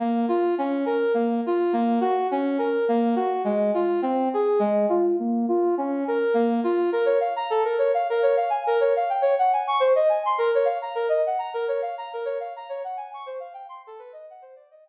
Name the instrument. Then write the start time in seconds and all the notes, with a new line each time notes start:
brass section
0.00 A#3
0.28 F4
0.58 C#4
0.86 A#4
1.14 A#3
1.46 F4
1.73 A#3
2.01 F#4
2.31 C#4
2.59 A#4
2.88 A#3
3.16 F#4
3.44 G#3
3.74 F4
4.02 C4
4.34 G#4
4.59 G#3
4.89 F4
5.19 A#3
5.48 F4
5.78 C#4
6.08 A#4
6.34 A#3
6.64 F4
6.92 A#4
7.06 C#5
7.20 F5
7.36 A#5
7.50 A4
7.65 A#4
7.78 C#5
7.94 F5
8.10 A#4
8.23 C#5
8.37 F5
8.50 G#5
8.67 A#4
8.81 C#5
8.96 F5
9.09 G5
9.22 C#5
9.39 F#5
9.53 G#5
9.67 C#6
9.80 C5
9.95 D#5
10.09 G#5
10.26 C6
10.38 A#4
10.55 C#5
10.65 F5
10.82 A#5
10.95 A#4
11.09 D#5
11.26 F#5
11.39 A#5
11.54 A#4
11.68 C#5
11.82 F5
11.98 A#5
12.13 A#4
12.25 C#5
12.40 F5
12.56 A#5
12.69 C#5
12.84 F#5
12.97 G#5
13.14 C#6
13.26 C5
13.40 F5
13.54 G5
13.69 C6
13.87 A4
13.99 B4
14.13 D#5
14.30 F#5
14.42 C5
14.56 D5
14.71 D#5
14.86 G5